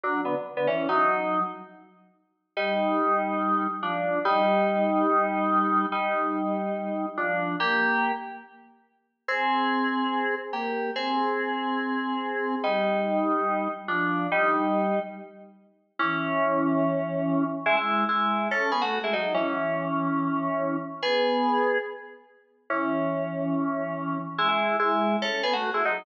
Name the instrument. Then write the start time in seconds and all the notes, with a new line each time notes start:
electric piano 2
0.03 F#3 D4
0.25 D3 B3
0.57 D3 B3
0.67 E3 C#4
0.89 F#3 D#4
2.57 G3 D#4
3.83 F3 D4
4.25 G3 D#4
5.92 G3 D#4
7.17 F3 D4
7.60 A#3 G4
9.28 C4 G#4
10.53 A#3 G4
10.96 C4 G#4
12.64 G3 D#4
13.88 F3 D4
14.32 G3 D#4
15.99 E3 C#4
17.66 G#3 E4
17.77 G#3 E4
18.09 G#3 E4
18.51 C#4 A4
18.72 B3 G#4
18.82 A3 F#4
19.04 G#3 E4
19.13 F#3 D#4
19.34 E3 C#4
21.03 B3 G#4
22.70 E3 C#4
24.38 G#3 E4
24.49 G#3 E4
24.79 G#3 E4
25.22 C#4 A4
25.43 B3 G#4
25.53 A3 F#4
25.74 G#3 E4
25.85 F#3 D#4